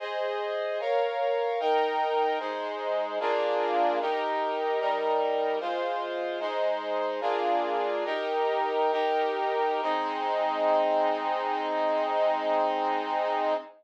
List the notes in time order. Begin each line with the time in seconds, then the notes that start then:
0.00 G#4 C5 D#5
0.80 A#4 C#5 F5
1.60 D#4 A#4 G5
2.40 G#3 D#4 C5
3.20 A#3 D4 F4 G#4
4.00 D#4 G4 A#4
4.80 G3 D#4 A#4
5.60 G#3 F4 C5
6.40 G#3 D#4 C5
7.21 A#3 D4 F4 G#4
8.05 D#4 G4 A#4
8.92 D#4 G4 A#4
9.82 G#3 C4 D#4